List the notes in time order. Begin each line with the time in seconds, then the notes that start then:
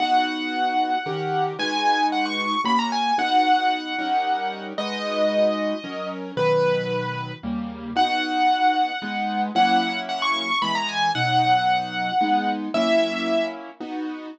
0.00 B3 D#4 F#4 F#5
1.06 D#3 C#4 G4 A#4
1.59 G#3 D#4 F#4 B4 G#5
2.12 F#5
2.26 C#6
2.64 A#3 C#4 F#4 B5
2.79 A#5
2.92 G#5
3.18 B3 D#4 F#4 F#5
3.98 G3 C#4 D#4 A#4
4.78 G#3 D#4 F#4 B4 D#5
5.84 F#3 C#4 A#4
6.37 B2 D#3 F#3 B4
7.43 D#2 C#3 G3 A#3
7.96 B3 D#4 F#4 F#5
9.02 G#3 B3 D#4
9.55 F#3 A#3 C#4 E4 F#5
10.09 F#5
10.22 C#6
10.62 E3 G#3 B3 B5
10.75 A#5
10.89 G#5
11.15 B2 F#3 D#4 F#5
12.21 G#3 B3 D#4
12.74 F#3 A#3 C#4 E4 E5
13.80 B3 D#4 F#4